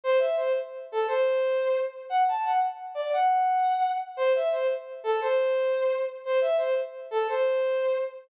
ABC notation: X:1
M:12/8
L:1/8
Q:3/8=116
K:Clyd
V:1 name="Brass Section"
c e c z2 A c5 z | f a f z2 d f5 z | c e c z2 A c5 z | c e c z2 A c5 z |]